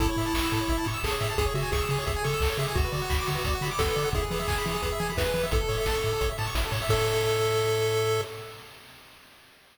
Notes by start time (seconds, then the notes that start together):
0.00 A1 E4 A4, kick, closed hi-hat
0.09 C#5
0.17 A2 E5, open hi-hat
0.26 A5
0.34 A1 C#6, kick, clap
0.44 E6
0.51 A2 A4, open hi-hat
0.61 C#5
0.68 A1 E5, kick, closed hi-hat
0.78 A5
0.84 A2 C#6, open hi-hat
0.94 E6
1.04 A1 G#4 A4, kick, clap
1.11 C#5
1.20 A2 E5, open hi-hat
1.30 A5
1.38 C#2 G#4, kick, closed hi-hat
1.46 C#5
1.54 C#3 F#4 E5, open hi-hat
1.63 G#5
1.72 C#2 G#4 C#6, kick, snare
1.80 E6
1.89 C#3 G#4, open hi-hat
1.98 C#5
2.06 C#2 G#4 E5, kick, closed hi-hat
2.16 G#5
2.24 C#3 A4 C#6, open hi-hat
2.34 E6
2.40 C#2 A4, kick, clap
2.49 C#5
2.58 C#3 G#4 E5, open hi-hat
2.68 G#5
2.75 D2 F#4, kick, closed hi-hat
2.85 B4
2.92 D3 D5, open hi-hat
3.02 F#5
3.10 D2 B5, kick, clap
3.19 D6
3.27 D3 F#4, open hi-hat
3.35 B4
3.44 D2 D5, kick, closed hi-hat
3.55 F#5
3.61 D3 B5, open hi-hat
3.71 D6
3.79 D2 F#4 A4, kick, snare
3.88 B4
3.96 D3 D5, open hi-hat
4.04 F#5
4.13 E2 E4 G#4, kick, closed hi-hat
4.22 G#4
4.31 E3 B4, open hi-hat
4.39 E5
4.48 E2 G#5, kick, clap
4.58 B5
4.65 E3 E4, open hi-hat
4.74 G#4
4.82 E2 B4, kick, closed hi-hat
4.92 E5
5.00 E3 G#5, open hi-hat
5.10 B5
5.17 E2 E4 B4, kick, snare
5.26 G#4
5.34 E3 B4, open hi-hat
5.43 E5
5.51 A1 E4 A4, kick, closed hi-hat
5.60 A4
5.69 A2 C#5, open hi-hat
5.78 E5
5.86 A1 A5, kick, snare
5.95 C#6
6.02 A2 E4, open hi-hat
6.12 A4
6.20 A1 C#5, kick, closed hi-hat
6.29 E5
6.38 A2 A5, open hi-hat
6.47 C#6
6.55 A1 E4, kick, snare
6.65 A4
6.72 A2 C#5, open hi-hat
6.82 E5
6.89 A2 A4 C#5 E5, kick, crash